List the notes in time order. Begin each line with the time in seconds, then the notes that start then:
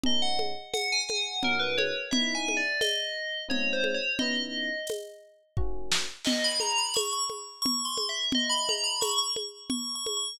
0.03 B2 A3 C#4 D#4 D#5, low conga
0.22 F#5
0.39 high conga
0.73 F#5, tambourine, high conga
0.92 G#5
1.09 F#5, high conga
1.43 A#2 F#3 C#4 D#4 A#4, low conga
1.59 B4
1.78 C#5, high conga
2.11 C#3 B3 D#4 E4 E5, low conga
2.35 G#5
2.48 high conga
2.57 D5
2.81 D#5, tambourine, high conga
3.48 G#3 C4 D#4 F4 C#5, low conga
3.73 C5
3.84 high conga
3.94 C#5
4.19 C#3 B3 D#4 E4 D#5, low conga
4.87 tambourine, high conga
5.57 D#3 A#3 C#4 F#4, kick
5.92 snare
6.25 D#5, crash, low conga
6.44 B5
6.60 A#5, high conga
6.78 B5
6.94 C#6, tambourine, high conga
7.13 C#6
7.30 high conga
7.62 C#6, low conga
7.85 C6
7.98 high conga
8.09 E5
8.32 D#5, low conga
8.49 B5
8.69 A#5, high conga
8.84 B5
9.01 C#6, tambourine, high conga
9.18 C#6
9.36 high conga
9.70 C#6, low conga
9.95 C#6
10.06 high conga
10.17 C#6